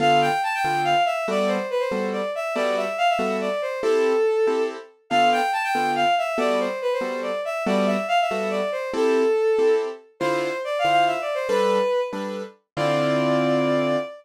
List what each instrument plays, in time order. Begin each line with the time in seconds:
0.00 acoustic grand piano D3 B3 F4 A4, violin F5
0.21 violin G5
0.43 violin A5
0.54 violin G5
0.65 acoustic grand piano D3 B3 F4 A4
0.84 violin F5
1.05 violin E5
1.28 acoustic grand piano G3 B3 F#4 A4, violin D5
1.48 violin C5
1.70 violin B4
1.79 violin C5
1.91 acoustic grand piano G3 B3 F#4 A4
2.12 violin D5
2.35 violin E5
2.55 acoustic grand piano G3 B3 F#4 A4, violin D5
2.77 violin E5
2.98 violin F5
3.09 violin E5
3.19 acoustic grand piano G3 B3 F#4 A4
3.41 violin D5
3.62 violin C5
3.82 acoustic grand piano C4 E4 G4 A4, violin A4
4.47 acoustic grand piano C4 E4 G4 A4
5.10 acoustic grand piano D3 B3 F4 A4, violin F5
5.32 violin G5
5.53 violin A5
5.64 violin G5
5.75 acoustic grand piano D3 B3 F4 A4
5.95 violin F5
6.18 violin E5
6.38 acoustic grand piano G3 B3 F#4 A4, violin D5
6.60 violin C5
6.82 violin B4
6.93 violin C5
7.01 acoustic grand piano G3 B3 F#4 A4
7.22 violin D5
7.45 violin E5
7.66 acoustic grand piano G3 B3 F#4 A4, violin D5
7.86 violin E5
8.08 violin F5
8.21 violin E5
8.31 acoustic grand piano G3 B3 F#4 A4
8.50 violin D5
8.72 violin C5
8.94 acoustic grand piano C4 E4 G4 A4, violin A4
9.59 acoustic grand piano C4 E4 G4 A4
10.20 acoustic grand piano D3 E4 F4 C5, violin C5
10.64 violin D5
10.79 violin F5
10.85 acoustic grand piano D3 E4 F4 C5
10.91 violin F5
11.07 violin E5
11.21 violin D5
11.34 violin C5
11.48 acoustic grand piano G3 D4 A4 B4, violin B4
12.13 acoustic grand piano G3 D4 A4 B4
12.77 acoustic grand piano D3 C4 E4 F4, violin D5